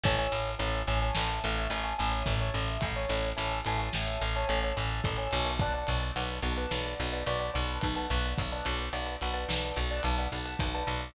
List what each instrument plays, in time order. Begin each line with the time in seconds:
0.03 electric bass (finger) A1, acoustic grand piano C#5 E5 G#5 A5, kick, closed hi-hat
0.18 acoustic grand piano C#5 E5 G#5 A5, closed hi-hat
0.32 electric bass (finger) A1, closed hi-hat
0.47 closed hi-hat
0.59 electric bass (finger) A1, acoustic grand piano C#5 E5 G#5 A5, closed hi-hat
0.74 closed hi-hat
0.87 electric bass (finger) A1, acoustic grand piano C#5 E5 G#5 A5, closed hi-hat
1.02 acoustic grand piano C#5 E5 G#5 A5, closed hi-hat
1.15 electric bass (finger) A1, snare
1.29 closed hi-hat
1.44 electric bass (finger) A1, closed hi-hat
1.55 acoustic grand piano C#5 E5 G#5 A5, closed hi-hat
1.70 electric bass (finger) A1, acoustic grand piano C#5 E5 G#5 A5, closed hi-hat
1.83 acoustic grand piano C#5 E5 G#5 A5, closed hi-hat
1.98 electric bass (finger) A1, acoustic grand piano C#5 E5 G#5 A5, closed hi-hat
2.12 closed hi-hat
2.26 electric bass (finger) A1, kick, closed hi-hat
2.39 acoustic grand piano C#5 E5 G#5 A5, closed hi-hat
2.54 electric bass (finger) A1, closed hi-hat
2.68 closed hi-hat
2.81 electric bass (finger) A1, kick, closed hi-hat
2.96 acoustic grand piano C#5 E5 G#5 A5, closed hi-hat
3.09 electric bass (finger) A1, closed hi-hat
3.25 closed hi-hat
3.36 electric bass (finger) A1, acoustic grand piano C#5 E5 G#5 A5, closed hi-hat
3.52 closed hi-hat
3.65 electric bass (finger) A1, acoustic grand piano C#5 E5 G#5 A5, closed hi-hat
3.78 acoustic grand piano C#5 E5 G#5 A5, closed hi-hat
3.93 electric bass (finger) A1, snare
4.07 closed hi-hat
4.21 electric bass (finger) A1, closed hi-hat
4.36 acoustic grand piano C#5 E5 G#5 A5, closed hi-hat
4.48 electric bass (finger) A1, acoustic grand piano C#5 E5 G#5 A5, closed hi-hat
4.63 acoustic grand piano C#5 E5 G#5 A5, closed hi-hat
4.77 electric bass (finger) A1, acoustic grand piano C#5 E5 G#5 A5, closed hi-hat
4.89 closed hi-hat
5.04 electric bass (finger) A1, kick, closed hi-hat
5.16 acoustic grand piano C#5 E5 G#5 A5, closed hi-hat
5.31 electric bass (finger) B1, closed hi-hat
5.45 open hi-hat
5.59 acoustic grand piano B4 D5 F#5 A5, kick, closed hi-hat
5.72 acoustic grand piano B4 D5 F#5 A5, closed hi-hat
5.87 electric bass (finger) B1, closed hi-hat
6.00 closed hi-hat
6.16 electric bass (finger) B1, acoustic grand piano B4 D5 F#5 A5, closed hi-hat
6.29 closed hi-hat
6.42 electric bass (finger) B1, acoustic grand piano B4 D5 F#5 A5, closed hi-hat
6.56 acoustic grand piano B4 D5 F#5 A5, closed hi-hat
6.71 electric bass (finger) B1, snare
6.86 closed hi-hat
7.00 electric bass (finger) B1, closed hi-hat
7.13 acoustic grand piano B4 D5 F#5 A5, closed hi-hat
7.26 electric bass (finger) B1, acoustic grand piano B4 D5 F#5 A5, closed hi-hat
7.39 acoustic grand piano B4 D5 F#5 A5, closed hi-hat
7.54 electric bass (finger) B1, acoustic grand piano B4 D5 F#5 A5, closed hi-hat
7.68 closed hi-hat
7.81 electric bass (finger) B1, kick, closed hi-hat
7.95 acoustic grand piano B4 D5 F#5 A5, closed hi-hat
8.10 electric bass (finger) B1, closed hi-hat
8.26 closed hi-hat
8.38 electric bass (finger) B1, kick, closed hi-hat
8.52 acoustic grand piano B4 D5 F#5 A5, closed hi-hat
8.65 electric bass (finger) B1, closed hi-hat
8.79 closed hi-hat
8.93 electric bass (finger) B1, acoustic grand piano B4 D5 F#5 A5, closed hi-hat
9.06 closed hi-hat
9.21 electric bass (finger) B1, acoustic grand piano B4 D5 F#5 A5, closed hi-hat
9.33 acoustic grand piano B4 D5 F#5 A5, closed hi-hat
9.49 electric bass (finger) B1, snare
9.64 closed hi-hat
9.76 electric bass (finger) B1, closed hi-hat
9.91 acoustic grand piano B4 D5 F#5 A5, closed hi-hat
10.03 electric bass (finger) B1, acoustic grand piano B4 D5 F#5 A5, closed hi-hat
10.18 acoustic grand piano B4 D5 F#5 A5, closed hi-hat
10.32 electric bass (finger) B1, acoustic grand piano B4 D5 F#5 A5, closed hi-hat
10.45 closed hi-hat
10.59 electric bass (finger) B1, kick, closed hi-hat
10.74 acoustic grand piano B4 D5 F#5 A5, closed hi-hat
10.87 electric bass (finger) B1, closed hi-hat
11.00 closed hi-hat